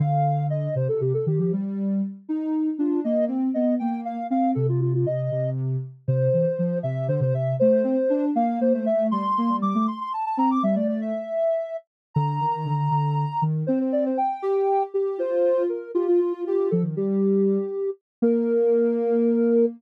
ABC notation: X:1
M:6/8
L:1/16
Q:3/8=79
K:Bb
V:1 name="Ocarina"
f4 e2 c A G A G G | z10 F2 | e2 z2 e2 g2 f2 f2 | A F F F e4 z4 |
[K:F] c6 e2 c c e2 | c6 f2 c c e2 | c'4 d'2 c' c' a a b d' | e d d e7 z2 |
[K:Bb] b12 | c c d c g6 z2 | c4 B2 G F F F F F | A z G8 z2 |
B12 |]
V:2 name="Ocarina"
D,6 C, C, C, z E, F, | G,4 z2 E4 D2 | B,2 C2 _C2 B,3 z =C2 | C,4 C,2 C,4 z2 |
[K:F] C,2 E, z F,2 C,2 D, C, C,2 | A,2 C z D2 B,2 B, A, A,2 | G, z B, G, G, A, z4 C2 | G, A,3 z8 |
[K:Bb] D,2 E,2 D,2 D,3 z E,2 | C4 z2 G4 G2 | F4 z2 F4 G2 | F, E, G,6 z4 |
B,12 |]